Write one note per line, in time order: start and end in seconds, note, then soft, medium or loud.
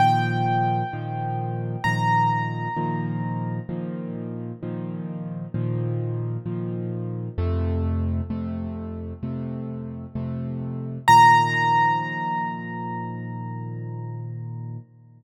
0.00 0.83 A#2 loud
0.00 0.83 D#3 loud
0.00 0.83 F3 loud
0.00 1.83 G5 medium
0.93 1.76 A#2 medium
0.93 1.76 D#3 medium
0.93 1.76 F3 medium
1.84 2.68 A#2 medium
1.84 2.68 D#3 medium
1.84 2.68 F3 medium
1.84 3.62 A#5 medium
2.77 3.60 A#2 loud
2.77 3.60 D#3 loud
2.77 3.60 F3 medium
3.69 4.52 A#2 loud
3.69 4.52 D#3 medium
3.69 4.52 F3 medium
4.63 5.46 A#2 medium
4.63 5.46 D#3 medium
4.63 5.46 F3 medium
5.54 6.37 A#2 loud
5.54 6.37 D#3 medium
5.54 6.37 F3 loud
6.46 7.29 A#2 medium
6.46 7.29 D#3 medium
6.46 7.29 F3 medium
7.38 8.21 F2 loud
7.38 8.21 C3 loud
7.38 8.21 A3 loud
8.30 9.13 F2 medium
8.30 9.13 C3 medium
8.30 9.13 A3 loud
9.23 10.06 F2 medium
9.23 10.06 C3 medium
9.23 10.06 A3 medium
10.15 10.98 F2 medium
10.15 10.98 C3 medium
10.15 10.98 A3 medium
11.08 14.78 A#2 loud
11.08 14.78 D#3 loud
11.08 14.78 F3 medium
11.08 14.77 A#5 loud